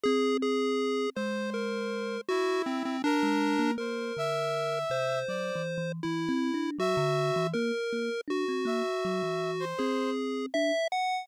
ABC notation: X:1
M:5/4
L:1/16
Q:1/4=80
K:none
V:1 name="Lead 1 (square)"
^G2 G4 c2 ^A4 ^F2 C C D4 | ^A6 c6 E4 ^F4 | ^A4 ^F8 ^G4 e2 ^f2 |]
V:2 name="Kalimba"
C6 ^G,6 z5 G,2 ^A, | ^A,2 D,4 C,2 (3^F,2 E,2 E,2 (3E,2 C2 D2 F, D,2 E, | ^A, z A, z D C A, z ^F, E,3 C4 D z3 |]
V:3 name="Brass Section"
z6 c6 E4 ^A4 | c2 e6 d2 z6 e4 | z6 e5 c3 z6 |]